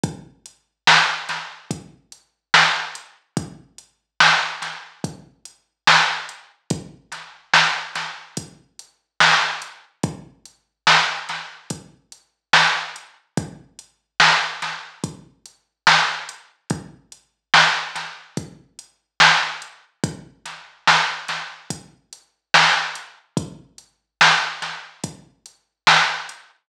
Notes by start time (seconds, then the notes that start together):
0.03 kick, closed hi-hat
0.46 closed hi-hat
0.87 snare
1.29 snare, closed hi-hat
1.71 kick, closed hi-hat
2.12 closed hi-hat
2.54 snare
2.95 closed hi-hat
3.37 kick, closed hi-hat
3.78 closed hi-hat
4.20 snare
4.62 snare, closed hi-hat
5.04 kick, closed hi-hat
5.45 closed hi-hat
5.87 snare
6.29 closed hi-hat
6.70 kick, closed hi-hat
7.12 snare, closed hi-hat
7.54 snare
7.95 snare, closed hi-hat
8.37 kick, closed hi-hat
8.79 closed hi-hat
9.20 snare
9.62 closed hi-hat
10.03 kick, closed hi-hat
10.45 closed hi-hat
10.87 snare
11.29 snare, closed hi-hat
11.70 kick, closed hi-hat
12.12 closed hi-hat
12.53 snare
12.96 closed hi-hat
13.37 kick, closed hi-hat
13.79 closed hi-hat
14.20 snare
14.62 snare, closed hi-hat
15.04 kick, closed hi-hat
15.46 closed hi-hat
15.87 snare
16.29 closed hi-hat
16.70 kick, closed hi-hat
17.12 closed hi-hat
17.54 snare
17.95 snare, closed hi-hat
18.37 kick, closed hi-hat
18.79 closed hi-hat
19.20 snare
19.62 closed hi-hat
20.04 kick, closed hi-hat
20.45 snare, closed hi-hat
20.87 snare
21.28 snare, closed hi-hat
21.70 kick, closed hi-hat
22.13 closed hi-hat
22.54 snare
22.95 closed hi-hat
23.37 kick, closed hi-hat
23.78 closed hi-hat
24.21 snare
24.62 snare, closed hi-hat
25.04 kick, closed hi-hat
25.46 closed hi-hat
25.87 snare
26.29 closed hi-hat